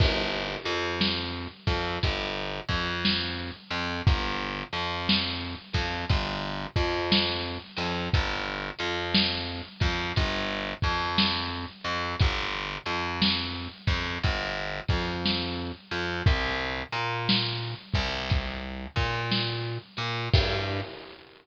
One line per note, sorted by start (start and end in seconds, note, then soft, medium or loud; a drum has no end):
0.00 0.56 G1 loud
0.00 kick loud
0.00 crash loud
0.65 1.47 F2 loud
0.65 closed hi-hat medium
1.01 snare loud
1.67 1.98 F2 loud
1.67 kick medium
1.67 snare medium
1.67 closed hi-hat medium
2.03 2.60 G1 loud
2.03 kick medium
2.03 closed hi-hat loud
2.69 3.51 F2 loud
2.69 kick medium
2.69 closed hi-hat medium
3.05 snare loud
3.70 4.01 F2 loud
3.70 closed hi-hat medium
4.07 4.63 G1 loud
4.07 kick loud
4.07 closed hi-hat medium
4.72 5.55 F2 loud
4.72 closed hi-hat medium
5.09 snare loud
5.73 6.05 F2 loud
5.73 kick medium
5.73 snare medium
5.73 closed hi-hat medium
6.09 6.65 G1 loud
6.09 kick medium
6.09 closed hi-hat medium
6.76 7.58 F2 loud
6.76 kick medium
6.76 closed hi-hat medium
7.12 snare loud
7.76 8.08 F2 loud
7.76 open hi-hat medium
8.14 8.70 G1 loud
8.14 kick medium
8.14 closed hi-hat loud
8.79 9.62 F2 loud
8.79 closed hi-hat medium
9.14 snare loud
9.80 10.12 F2 loud
9.80 kick medium
9.80 snare medium
9.80 closed hi-hat medium
10.16 10.73 G1 loud
10.16 kick medium
10.16 closed hi-hat loud
10.82 11.65 F2 loud
10.82 kick medium
10.82 closed hi-hat medium
11.18 snare loud
11.84 12.15 F2 medium
11.84 closed hi-hat medium
12.19 12.77 G1 loud
12.19 kick loud
12.19 closed hi-hat loud
12.86 13.68 F2 medium
12.86 closed hi-hat medium
13.22 snare loud
13.87 14.18 F2 loud
13.87 kick medium
13.87 snare medium
13.87 closed hi-hat medium
14.23 14.80 G1 loud
14.23 kick medium
14.23 closed hi-hat medium
14.88 15.72 F2 loud
14.88 kick medium
14.88 closed hi-hat medium
15.25 snare medium
15.91 16.22 F2 medium
15.91 closed hi-hat medium
16.26 16.82 C2 loud
16.26 kick loud
16.26 closed hi-hat medium
16.92 17.74 A#2 medium
16.92 closed hi-hat medium
17.29 snare loud
17.94 18.87 C2 loud
17.94 kick medium
17.94 snare medium
17.94 closed hi-hat medium
18.30 kick medium
18.30 closed hi-hat medium
18.96 19.78 A#2 loud
18.96 kick medium
18.96 closed hi-hat medium
19.31 snare medium
19.97 20.28 A#2 loud
19.97 closed hi-hat medium
20.33 20.81 G2 loud
20.33 kick loud
20.33 crash loud